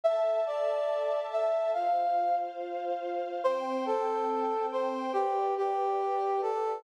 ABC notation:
X:1
M:4/4
L:1/8
Q:1/4=141
K:C
V:1 name="Brass Section"
e2 d4 e2 | f3 z5 | c2 A4 c2 | G2 G4 A2 |]
V:2 name="String Ensemble 1"
[Aea]8 | [Fcf]8 | [Ccg]8 | [GBd]8 |]